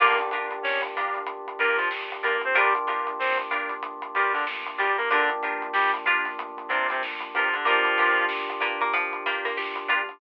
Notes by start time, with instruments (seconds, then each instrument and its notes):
0.00 synth bass 1 G1, clarinet A#3 A#4, pad 5 (bowed) A#3 D4 F4 G4, electric piano 1 A#3 D4 F4 G4, acoustic guitar (steel) D4 F4 G4 A#4, harpsichord F4, kick, crash
0.18 closed hi-hat
0.31 synth bass 1 G2, acoustic guitar (steel) D4 F4 G4 A#4, closed hi-hat
0.51 closed hi-hat
0.63 synth bass 1 G1, clarinet C#4 C#5, snare
0.82 closed hi-hat
0.95 synth bass 1 G2, acoustic guitar (steel) D4 F4 G4 A#4, snare, closed hi-hat
1.14 closed hi-hat
1.26 synth bass 1 G1, kick, closed hi-hat
1.48 closed hi-hat
1.59 synth bass 1 G2, clarinet A#3 A#4, acoustic guitar (steel) D4 F4 G4 A#4, kick, closed hi-hat
1.77 clarinet F3 F4, snare, closed hi-hat
1.91 synth bass 1 G1, snare
2.12 closed hi-hat
2.23 synth bass 1 G2, clarinet A#3 A#4, acoustic guitar (steel) D4 F4 G4 A#4, closed hi-hat
2.41 clarinet C4 C5, closed hi-hat
2.55 synth bass 1 G1, clarinet G3 G4, electric piano 1 A#3 D4 F4 G4, pad 5 (bowed) A#3 D4 F4 G4, acoustic guitar (steel) D4 F4 G4 A#4, harpsichord A#4, kick, closed hi-hat
2.75 closed hi-hat
2.87 synth bass 1 G2, acoustic guitar (steel) D4 F4 G4 A#4, snare, closed hi-hat
3.07 closed hi-hat
3.19 synth bass 1 G1, clarinet C4 C5, snare
3.38 closed hi-hat
3.51 synth bass 1 G2, acoustic guitar (steel) D4 F4 G4 A#4, closed hi-hat
3.69 closed hi-hat
3.83 synth bass 1 G1, kick, closed hi-hat
4.02 closed hi-hat
4.14 synth bass 1 G2, clarinet G3 G4, acoustic guitar (steel) D4 F4 G4 A#4, closed hi-hat
4.33 clarinet D3 D4, snare, closed hi-hat
4.47 synth bass 1 G1, snare
4.66 closed hi-hat
4.78 synth bass 1 G2, clarinet G3 G4, acoustic guitar (steel) D4 F4 G4 A#4, closed hi-hat
4.97 clarinet A#3 A#4, closed hi-hat
5.11 synth bass 1 G1, clarinet D3 D4, electric piano 1 A#3 D4 F4 G4, pad 5 (bowed) A#3 D4 F4 G4, harpsichord D4, acoustic guitar (steel) D4 F4 G4 A#4, kick, closed hi-hat
5.29 closed hi-hat
5.42 synth bass 1 G2, acoustic guitar (steel) D4 F4 G4 A#4, closed hi-hat
5.62 closed hi-hat
5.73 synth bass 1 G1, clarinet G3 G4, snare
5.94 closed hi-hat
6.06 synth bass 1 G2, acoustic guitar (steel) D4 F4 G4 A#4, harpsichord F4, snare, closed hi-hat
6.25 snare, closed hi-hat
6.38 synth bass 1 G1, closed hi-hat
6.57 kick, closed hi-hat
6.68 synth bass 1 G2, clarinet C3 C4, acoustic guitar (steel) D4 F4 G4 A#4, kick, closed hi-hat
6.88 clarinet C3 C4, snare, closed hi-hat
7.02 synth bass 1 G1, snare
7.20 closed hi-hat
7.34 synth bass 1 G2, clarinet F3 F4, acoustic guitar (steel) D4 F4 G4 A#4, closed hi-hat
7.53 clarinet D3 D4, kick, closed hi-hat
7.65 synth bass 1 G1, clarinet F3 F4, harpsichord A#3, pad 5 (bowed) A#3 D4 F4 G4, electric piano 1 A#3 D4 F4 G4, acoustic guitar (steel) D4 F4 G4 A#4, kick, closed hi-hat
7.84 closed hi-hat
7.98 synth bass 1 G2, acoustic guitar (steel) D4 F4 G4 A#4, closed hi-hat
8.17 closed hi-hat
8.29 synth bass 1 G1, snare
8.48 snare, closed hi-hat
8.60 synth bass 1 G2, harpsichord A#3, acoustic guitar (steel) D4 F4 G4 A#4, closed hi-hat
8.81 harpsichord A#3, closed hi-hat
8.93 synth bass 1 G1, harpsichord F3, kick, closed hi-hat
9.13 kick, closed hi-hat
9.25 synth bass 1 G2, harpsichord A#3, acoustic guitar (steel) D4 F4 G4 A#4, closed hi-hat
9.45 harpsichord A#3, snare, closed hi-hat
9.57 synth bass 1 G1, harpsichord G4, snare
9.76 closed hi-hat
9.88 synth bass 1 G2, acoustic guitar (steel) D4 F4 G4 A#4, harpsichord F4, closed hi-hat
10.09 closed hi-hat